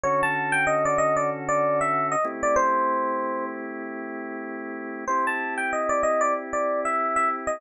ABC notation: X:1
M:4/4
L:1/16
Q:"Swing 16ths" 1/4=95
K:Ador
V:1 name="Electric Piano 1"
^c a2 g _e d e d z d2 =e2 _e z d | c6 z10 | c a2 g _e d e d z d2 =e2 e z ^d |]
V:2 name="Drawbar Organ"
[D,^CFA]14 [A,=CEG]2- | [A,CEG]16 | [CEG]16 |]